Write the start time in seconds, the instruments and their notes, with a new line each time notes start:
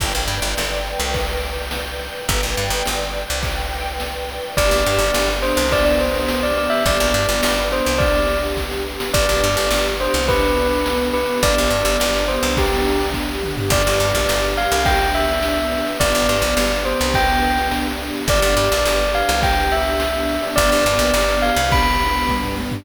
0.00 electric bass (finger) G1, string ensemble 1 B4 D5 G5, kick, crash
0.15 electric bass (finger) A#1
0.28 electric bass (finger) G2, ride
0.42 electric bass (finger) G1
0.57 electric bass (finger) G1, snare
0.86 ride
1.00 electric bass (finger) C2
1.14 kick, ride
1.43 ride
1.71 snare
2.00 ride
2.28 electric bass (finger) G1, string ensemble 1 B4 D5 G5, kick, ride
2.43 electric bass (finger) A#1
2.57 electric bass (finger) G2, ride
2.70 electric bass (finger) G1
2.85 electric bass (finger) G1, snare
3.14 ride
3.30 electric bass (finger) C2
3.43 kick, ride
3.71 ride
4.00 snare
4.29 ride
4.57 electric bass (finger) G1, string ensemble 1 B3 D4 G4, tubular bells D5, kick, ride
4.71 electric bass (finger) A#1, ride
4.86 electric bass (finger) G2, ride
4.99 electric bass (finger) G1, ride
5.14 electric bass (finger) G1, snare
5.28 ride
5.42 tubular bells C5, ride
5.57 electric bass (finger) C2, ride
5.71 tubular bells D5, kick, ride
5.85 tubular bells D5, ride
5.99 tubular bells C5, ride
6.14 ride
6.28 snare
6.43 tubular bells D5, ride
6.57 tubular bells D5, ride
6.70 tubular bells E5, ride
6.86 electric bass (finger) G1, string ensemble 1 B3 D4 G4, tubular bells D5, kick, ride
7.00 electric bass (finger) A#1, ride
7.14 electric bass (finger) G2, ride
7.29 electric bass (finger) G1, ride
7.43 electric bass (finger) G1, snare
7.57 ride
7.72 tubular bells C5, ride
7.86 electric bass (finger) C2, ride
7.98 tubular bells D5, kick, ride
8.14 ride
8.29 ride
8.43 ride
8.57 kick, snare
8.71 snare
9.00 snare
9.14 electric bass (finger) G1, string ensemble 1 B3 D4 G4, tubular bells D5, kick, crash
9.29 electric bass (finger) A#1, ride
9.43 electric bass (finger) G2, ride
9.57 electric bass (finger) G1, ride
9.71 electric bass (finger) G1, snare
9.85 ride
10.01 tubular bells C5, ride
10.14 electric bass (finger) C2, ride
10.28 tubular bells B4, kick, ride
10.43 ride
10.57 ride
10.72 ride
10.86 snare
11.00 ride
11.14 tubular bells B4, ride
11.29 ride
11.42 electric bass (finger) G1, string ensemble 1 B3 D4 G4, tubular bells D5, kick, ride
11.58 electric bass (finger) A#1, ride
11.70 electric bass (finger) G2, ride
11.85 electric bass (finger) G1, ride
12.00 electric bass (finger) G1, snare
12.14 ride
12.28 tubular bells C5, ride
12.43 electric bass (finger) C2, ride
12.57 tubular bells G4, kick, ride
12.71 ride
12.86 ride
13.00 ride
13.14 kick, snare
13.43 mid tom
13.57 floor tom
13.70 electric bass (finger) G1, string ensemble 1 B3 D4 G4, tubular bells D5, kick, crash
13.85 electric bass (finger) G1, ride
14.00 electric bass (finger) G2, ride
14.14 electric bass (finger) A#1, ride
14.29 electric bass (finger) G1, snare
14.43 ride
14.57 tubular bells F5, ride
14.71 electric bass (finger) C2, ride
14.85 tubular bells G5, kick, ride
15.01 ride
15.14 tubular bells E5, ride
15.28 ride
15.42 snare
15.57 ride
15.72 ride
15.86 ride
16.00 electric bass (finger) G1, string ensemble 1 B3 D4 G4, tubular bells D5, kick, ride
16.14 electric bass (finger) G1, ride
16.29 electric bass (finger) G2, ride
16.42 electric bass (finger) A#1, ride
16.57 electric bass (finger) G1, snare
16.71 ride
16.85 tubular bells C5, ride
17.00 electric bass (finger) C2, ride
17.14 tubular bells G5, kick, ride
17.29 ride
17.42 ride
17.57 ride
17.71 snare
17.86 ride
18.00 ride
18.14 ride
18.28 electric bass (finger) G1, string ensemble 1 B3 D4 G4, tubular bells D5, kick, ride
18.42 electric bass (finger) G1, ride
18.57 electric bass (finger) G2, ride
18.71 electric bass (finger) A#1, ride
18.85 electric bass (finger) G1, snare
19.00 ride
19.14 tubular bells F5, ride
19.29 electric bass (finger) C2, ride
19.42 tubular bells G5, kick, ride
19.57 ride
19.71 tubular bells E5, ride
19.86 ride
20.00 snare
20.15 ride
20.29 ride
20.43 ride
20.56 electric bass (finger) G1, string ensemble 1 B3 D4 G4, tubular bells D5, kick, ride
20.71 electric bass (finger) G1, ride
20.86 electric bass (finger) G2, ride
20.99 electric bass (finger) A#1, ride
21.14 electric bass (finger) G1, snare
21.29 ride
21.42 tubular bells F5, ride
21.56 electric bass (finger) C2, ride
21.71 tubular bells B5, kick, ride
21.86 ride
22.00 ride
22.15 ride
22.28 kick, high tom
22.43 floor tom
22.57 high tom
22.71 floor tom